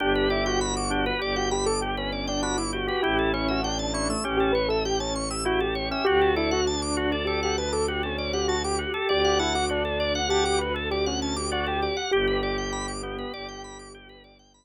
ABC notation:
X:1
M:5/4
L:1/16
Q:1/4=99
K:Glyd
V:1 name="Acoustic Grand Piano"
G2 E F F4 G F G A G C2 D F E F2 | G2 E F D4 G G B A G C2 G F G G2 | G2 E F D4 G G B A G C2 G F G G2 | G2 E F D4 G G B A G C2 G F G G2 |
G16 z4 |]
V:2 name="Drawbar Organ"
D2 G2 z2 D B G2 z6 D z2 G | E2 C2 z2 E A, C2 z6 E z2 C | F2 A2 z2 F d A2 z6 F z2 A | d2 f2 z2 d f f2 z6 d z2 f |
G2 G4 B,2 G4 z8 |]
V:3 name="Drawbar Organ"
G B d g b d' G B d g b d' G B d g b d' G B | G A c e g a c' e' G A c e g a c' e' G A c e | F A d f a d' F A d f a d' F A d f a d' F A | d f a d' F A d f a d' F A d f a d' F A d f |
G B d g b d' G B d g b d' G B d g b z3 |]
V:4 name="Violin" clef=bass
G,,,8 G,,,12 | A,,,8 A,,,12 | D,,20 | D,,20 |
G,,,8 G,,,12 |]